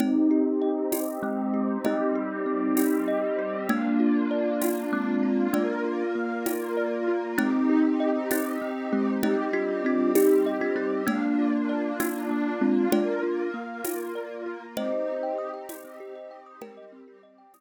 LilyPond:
<<
  \new Staff \with { instrumentName = "Kalimba" } { \time 6/8 \key c \minor \tempo 4. = 65 <c' ees'>2 <aes c'>4 | <c' ees'>2. | <bes d'>2 <aes c'>4 | <bes d'>4 r2 |
<c' ees'>4. <c' ees'>8 r8 <aes c'>8 | <c' ees'>8 <d' f'>8 <d' f'>8 <ees' g'>8. <d' f'>16 <c' ees'>8 | <bes d'>4. <bes d'>8 r8 <aes c'>8 | <d' f'>4 r2 |
<c'' ees''>2. | <g' bes'>4 r2 | }
  \new Staff \with { instrumentName = "Kalimba" } { \time 6/8 \key c \minor c'8 g'8 ees''8 g'8 c'8 g'8 | ees''8 g'8 c'8 g'8 ees''8 g'8 | bes8 f'8 d''8 f'8 bes8 f'8 | d''8 f'8 bes8 f'8 d''8 f'8 |
c'8 g'8 ees''8 g'8 c'8 g'8 | ees''8 g'8 c'8 g'8 ees''8 g'8 | bes8 f'8 d''8 f'8 bes8 f'8 | d''8 f'8 bes8 f'8 d''8 f'8 |
c'16 g'16 ees''16 g''16 ees'''16 g''16 ees''16 c'16 g'16 ees''16 g''16 ees'''16 | g''16 ees''16 c'16 g'16 ees''16 g''16 ees'''16 r4 r16 | }
  \new Staff \with { instrumentName = "Pad 2 (warm)" } { \time 6/8 \key c \minor <c' ees' g'>2. | <g c' g'>2. | <bes d' f'>2. | <bes f' bes'>2. |
<c' ees' g'>2. | <g c' g'>2. | <bes d' f'>2. | <bes f' bes'>2. |
<c' ees' g'>2. | <g c' g'>2. | }
  \new DrumStaff \with { instrumentName = "Drums" } \drummode { \time 6/8 <cgl cb>4. <cgho cb tamb>4. | <cgl cb>4. <cgho cb tamb>4. | <cgl cb>4. <cgho cb tamb>4. | <cgl cb>4. <cgho cb tamb>4. |
<cgl cb>4. <cgho cb tamb>4. | <cgl cb>4. <cgho cb tamb>4. | <cgl cb>4. <cgho cb tamb>4. | <cgl cb>4. <cgho cb tamb>4. |
<cgl cb>4. <cgho cb tamb>4. | <cgl cb>4. <cgho cb tamb>4. | }
>>